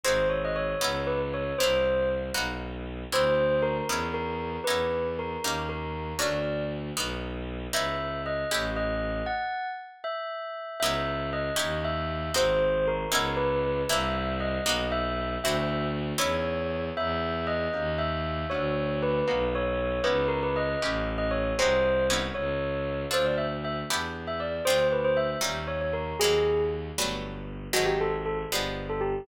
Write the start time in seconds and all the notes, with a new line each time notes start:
0.04 G#1 C4 D#4 F#4 G#4 C5
0.29 C#5
0.45 D#5
0.56 C#5
0.81 C#2 B3 C#4 D#4 E4
1.07 B4
1.34 C#5
1.58 C2 A#3 C4 D4 E4 C5
2.34 B1 A#3 B3 D#4 F#4
3.10 D2 C4 D4 E4 F#4 C5
3.62 A#4
3.87 E2 B3 C#4 D#4 E4
4.14 A#4
4.64 E2 B3 C#4 D#4 E4 B4
5.19 A#4
5.43 D#2 A#3 C#4 D#4 G4
5.69 A#4
6.19 D2 A3 C#4 D4 F#4 D5
6.96 B1 A#3 B3 D#4 F#4
7.73 C#2 B3 C#4 D#4 E4 E5
8.26 D#5
8.51 A1 A3 C#4 E4 G4
8.76 D#5
9.26 F#5
10.04 E5
10.80 C#2 B3 C#4 D#4 E4 E5
11.33 D#5
11.56 D#2 C#4 D#4 E4 G4
11.84 E5
12.34 G#1 C4 D#4 F#4 G#4 C5
12.87 A#4
13.12 C#2 B3 C#4 D#4 E4
13.37 B4
13.89 C2 A#3 C4 D4 E4 E5
14.40 D#5
14.66 B1 A#3 B3 D#4 F#4
14.92 E5
15.42 D2 C4 D4 E4 F#4 E5
16.18 E2 B3 C#4 D#4 E4 C#5
16.97 E2 B3 C#4 D#4 E4 E5
17.47 D#5
17.73 D#2 A#3 C#4 D#4 G4
17.98 E5
18.50 D2 A3 C#4 D4 F#4 C#5
19.02 B4
19.28 B1 A#3 B3 D#4 F#4
19.55 C#5
20.04 C#2 B3 C#4 D#4 E4 B4
20.28 A#4
20.43 B4
20.56 D#5
20.82 A1 A3 C#4 E4 G4
21.18 D#5
21.31 C#5
21.59 C2 G#3 C4 D#4 F#4 C5
22.10 B3 C#4 D#4 E4
22.34 C#2 C#5
23.11 D2 C4 D4 F4 A4 C5
23.25 D5
23.38 E5
23.64 E5
23.90 E2 B3 D4 E4 G4
24.27 E5
24.40 D5
24.65 D2 A3 C4 D4 F4 C5
24.92 B4
25.04 C5
25.17 E5
25.41 D#2 G3 C#4 D#4 F4
25.67 C#5
25.81 C#5
25.93 A#4
26.19 D#2 F#3 G#3 A#3 C4 G#4
26.97 G1 F#3 G3 A3 B3
27.73 G#1 D#3 F#3 G#3 C4 F#4
27.86 G4
28.01 A4
28.26 A4
28.49 G1 F3 G3 G#3 B3
28.89 A4
29.01 G4